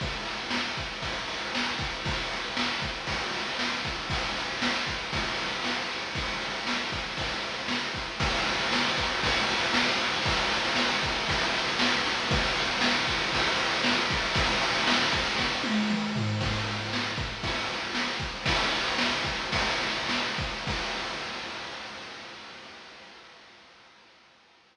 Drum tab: CC |----------------|----------------|----------------|----------------|
RD |x-x---x-x-x---x-|x-x---x-x-x---x-|x-x---x-x-x---x-|x-x---x-x-x---x-|
SD |----o-------o---|----o-------o---|----o-------o---|----o-------o---|
T1 |----------------|----------------|----------------|----------------|
T2 |----------------|----------------|----------------|----------------|
FT |----------------|----------------|----------------|----------------|
BD |o-----o-o-----o-|o-----o-o-----o-|o-----o-o-------|o-----o-o-----o-|

CC |x---------------|----------------|----------------|----------------|
RD |-xxx-xxxxxxx-xxx|xxxx-xxxxxxx-xxx|xxxx-xxxxxxx-xxx|xxxx-xxx--------|
SD |----o-------o---|----o-------o---|----o-------o---|----o---o-------|
T1 |----------------|----------------|----------------|----------o-----|
T2 |----------------|----------------|----------------|------------o---|
FT |----------------|----------------|----------------|--------------o-|
BD |o-----o-o-------|o-----o-o-------|o-----o-o-----o-|o-----o-o-------|

CC |x---------------|----------------|x---------------|
RD |--------x-------|x-------x-------|----------------|
SD |----o-------o---|----o-------o---|----------------|
T1 |----------------|----------------|----------------|
T2 |----------------|----------------|----------------|
FT |----------------|----------------|----------------|
BD |o-----o-o-----o-|o-----o-o-----o-|o---------------|